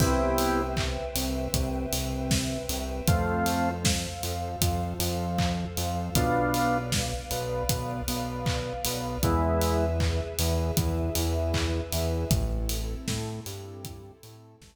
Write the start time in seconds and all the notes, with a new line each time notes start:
0.00 C2 B3 C4 E4 G4 B4 C5 E5 G5, kick, crash
0.38 open hi-hat
0.77 kick, clap
1.16 C2 C3, open hi-hat
1.53 C2 C3, kick, closed hi-hat
1.92 C2 C3, open hi-hat
2.31 kick, snare
2.69 C2 C3, open hi-hat
3.08 F2 A3 C4 F4 A4 C5 F5, kick, closed hi-hat
3.46 open hi-hat
3.85 kick, snare
4.23 F2 F3, open hi-hat
4.61 F2 F3, kick, closed hi-hat
4.99 F2 F3, open hi-hat
5.38 kick, clap
5.77 F2 F3, open hi-hat
6.15 B1 B3 D4 F4 B4 D5 F5, kick, closed hi-hat
6.54 open hi-hat
6.92 kick, snare
7.31 B1 B3, open hi-hat
7.69 B1 B3, kick, closed hi-hat
8.08 B1 B3, open hi-hat
8.46 kick, clap
8.85 B1 B3, open hi-hat
9.23 E2 G#3 B3 E4 G#4 B4 E5, kick, closed hi-hat
9.61 open hi-hat
10.00 kick, clap
10.39 E2 E3, open hi-hat
10.77 E2 E3, kick, closed hi-hat
11.15 E2 E3, open hi-hat
11.54 kick, clap
11.92 E2 E3, open hi-hat
12.31 A1 C4 E4 A4, kick, closed hi-hat
12.69 open hi-hat
13.08 A2 A3, kick, snare
13.46 G2 G3, open hi-hat
13.85 kick, closed hi-hat
14.23 A2 A3, open hi-hat
14.61 A1 A3, kick, snare